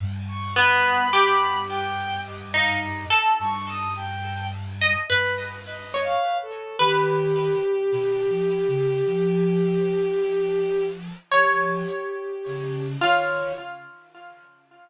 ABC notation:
X:1
M:6/4
L:1/16
Q:1/4=53
K:none
V:1 name="Pizzicato Strings"
z2 B,2 G4 z ^D2 A5 z ^d B2 z ^c3 | B16 ^c6 F2 |]
V:2 name="Ocarina" clef=bass
G,,12 G,,6 G,,4 z2 | ^D,3 z (3B,,2 F,2 ^C,2 F,8 F,2 z2 C,2 D,2 |]
V:3 name="Violin"
z ^c' b4 g2 ^d f z2 c' ^d' g2 z4 (3d2 f2 A2 | G16 G6 ^c2 |]